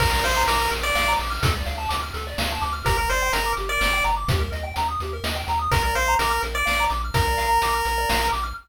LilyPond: <<
  \new Staff \with { instrumentName = "Lead 1 (square)" } { \time 3/4 \key bes \major \tempo 4 = 126 bes'16 bes'16 c''8 bes'8 r16 d''8. r8 | r2. | bes'16 bes'16 c''8 bes'8 r16 d''8. r8 | r2. |
bes'16 bes'16 c''8 bes'8 r16 d''8. r8 | bes'2~ bes'8 r8 | }
  \new Staff \with { instrumentName = "Lead 1 (square)" } { \time 3/4 \key bes \major bes'16 d''16 f''16 bes''16 d'''16 f'''16 bes'16 d''16 f''16 bes''16 d'''16 f'''16 | a'16 d''16 f''16 a''16 d'''16 f'''16 a'16 d''16 f''16 a''16 d'''16 f'''16 | g'16 bes'16 d''16 g''16 bes''16 d'''16 g'16 bes'16 d''16 g''16 bes''16 d'''16 | g'16 bes'16 ees''16 g''16 bes''16 ees'''16 g'16 bes'16 ees''16 g''16 bes''16 ees'''16 |
bes'16 d''16 f''16 bes''16 d'''16 f'''16 bes'16 d''16 f''16 bes''16 d'''16 f'''16 | bes'16 d''16 f''16 bes''16 d'''16 f'''16 bes'16 d''16 f''16 bes''16 d'''16 f'''16 | }
  \new Staff \with { instrumentName = "Synth Bass 1" } { \clef bass \time 3/4 \key bes \major bes,,8 bes,,8 bes,,8 bes,,8 bes,,8 bes,,8 | d,8 d,8 d,8 d,8 d,8 d,8 | g,,8 g,,8 g,,8 g,,8 g,,8 g,,8 | ees,8 ees,8 ees,8 ees,8 ees,8 ees,8 |
bes,,8 bes,,8 bes,,8 bes,,8 bes,,8 bes,,8 | bes,,8 bes,,8 bes,,8 bes,,8 bes,,8 bes,,8 | }
  \new DrumStaff \with { instrumentName = "Drums" } \drummode { \time 3/4 <cymc bd>8 hh8 hh8 hh8 sn8 hh8 | <hh bd>8 hh8 hh8 hh8 sn8 hh8 | <hh bd>8 hh8 hh8 hh8 sn8 hh8 | <hh bd>8 hh8 hh8 hh8 sn8 hh8 |
<hh bd>8 hh8 hh8 hh8 sn8 hh8 | <hh bd>8 hh8 hh8 hh8 sn8 hh8 | }
>>